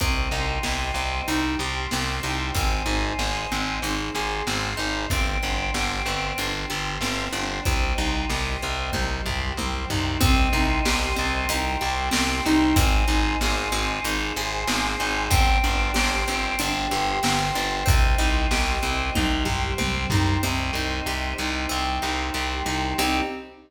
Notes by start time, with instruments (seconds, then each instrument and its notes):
0.00 electric bass (finger) C2, orchestral harp C4, choir aahs C5 D#5 G5, kick, closed hi-hat
0.31 electric bass (finger) C2, orchestral harp D#4
0.63 electric bass (finger) C2, orchestral harp G4, snare
0.94 electric bass (finger) C2, orchestral harp C4
1.28 electric bass (finger) C2, orchestral harp D#4, choir aahs G4 C5 G5, closed hi-hat
1.59 electric bass (finger) C2, orchestral harp G4
1.91 electric bass (finger) C2, orchestral harp C4, snare
2.23 electric bass (finger) C2, orchestral harp D#4
2.55 electric bass (finger) G#1, orchestral harp C4, choir aahs C5 D#5 G#5, kick, closed hi-hat
2.86 electric bass (finger) G#1, orchestral harp D#4
3.19 electric bass (finger) G#1, orchestral harp G#4, snare
3.52 electric bass (finger) G#1, orchestral harp C4
3.82 electric bass (finger) G#1, orchestral harp D#4, choir aahs G#4 C5 G#5, closed hi-hat
4.15 electric bass (finger) G#1, orchestral harp G#4
4.47 electric bass (finger) G#1, orchestral harp C4, snare
4.77 electric bass (finger) G#1, orchestral harp D#4
5.10 electric bass (finger) G1, orchestral harp C4, choir aahs C5 D5 G5, kick, closed hi-hat
5.43 electric bass (finger) G1, orchestral harp D4
5.74 electric bass (finger) G1, orchestral harp G4, snare
6.06 electric bass (finger) G1, orchestral harp C4
6.38 electric bass (finger) G1, orchestral harp D4, choir aahs G4 C5 G5, closed hi-hat
6.70 electric bass (finger) G1, orchestral harp G4
7.01 electric bass (finger) G1, orchestral harp C4, snare
7.33 electric bass (finger) G1, orchestral harp D4
7.65 electric bass (finger) C2, orchestral harp C4, choir aahs C5 D#5 G5, kick, closed hi-hat
7.98 electric bass (finger) C2, orchestral harp D#4
8.30 electric bass (finger) C2, orchestral harp G4, snare
8.62 electric bass (finger) C2, orchestral harp C4
8.93 electric bass (finger) C2, orchestral harp D#4, choir aahs G4 C5 G5, kick, high tom
9.25 electric bass (finger) C2, orchestral harp G4, floor tom
9.57 electric bass (finger) C2, orchestral harp C4, high tom
9.90 electric bass (finger) C2, orchestral harp D#4, floor tom
10.20 electric bass (finger) C2, orchestral harp C4, choir aahs C5 D#5 G5, kick, closed hi-hat
10.53 electric bass (finger) C2, orchestral harp D#4
10.85 electric bass (finger) C2, orchestral harp G4, snare
11.16 electric bass (finger) C2, orchestral harp C4
11.49 electric bass (finger) C2, orchestral harp D#4, choir aahs G4 C5 G5, closed hi-hat
11.81 electric bass (finger) C2, orchestral harp G4
12.11 electric bass (finger) C2, orchestral harp C4, snare
12.46 electric bass (finger) C2, orchestral harp D#4
12.76 electric bass (finger) G#1, orchestral harp C4, choir aahs C5 D#5 G#5, kick, closed hi-hat
13.08 electric bass (finger) G#1, orchestral harp D#4
13.41 electric bass (finger) G#1, orchestral harp G#4, snare
13.72 electric bass (finger) G#1, orchestral harp C4
14.04 electric bass (finger) G#1, orchestral harp D#4, choir aahs G#4 C5 G#5, closed hi-hat
14.36 electric bass (finger) G#1, orchestral harp G#4
14.67 electric bass (finger) G#1, orchestral harp C4, snare
15.00 electric bass (finger) G#1, orchestral harp D#4
15.30 electric bass (finger) G1, orchestral harp C4, choir aahs C5 D5 G5, kick, closed hi-hat
15.64 electric bass (finger) G1, orchestral harp D4
15.94 electric bass (finger) G1, orchestral harp G4, snare
16.28 electric bass (finger) G1, orchestral harp C4
16.59 electric bass (finger) G1, orchestral harp D4, choir aahs G4 C5 G5, closed hi-hat
16.91 electric bass (finger) G1, orchestral harp G4
17.23 electric bass (finger) G1, orchestral harp C4, snare
17.55 electric bass (finger) G1, orchestral harp D4
17.86 electric bass (finger) C2, orchestral harp C4, choir aahs C5 D#5 G5, kick, closed hi-hat
18.18 electric bass (finger) C2, orchestral harp D#4
18.51 electric bass (finger) C2, orchestral harp G4, snare
18.83 electric bass (finger) C2, orchestral harp C4
19.15 electric bass (finger) C2, orchestral harp D#4, choir aahs G4 C5 G5, kick, high tom
19.45 electric bass (finger) C2, orchestral harp G4, floor tom
19.78 electric bass (finger) C2, orchestral harp C4, high tom
20.10 electric bass (finger) C2, orchestral harp D#4, floor tom
20.43 electric bass (finger) C2, orchestral harp C4, choir aahs C5 D#5 G5
20.73 electric bass (finger) C2, orchestral harp D#4
21.06 electric bass (finger) C2, orchestral harp G4
21.38 electric bass (finger) C2, orchestral harp D#4
21.69 electric bass (finger) C2, orchestral harp C4, choir aahs G4 C5 G5
22.02 electric bass (finger) C2, orchestral harp D#4
22.34 electric bass (finger) C2, orchestral harp G4
22.66 electric bass (finger) C2, orchestral harp D#4
22.98 electric bass (finger) C2, choir aahs C4 D#4 G4, orchestral harp C4 D#4 G4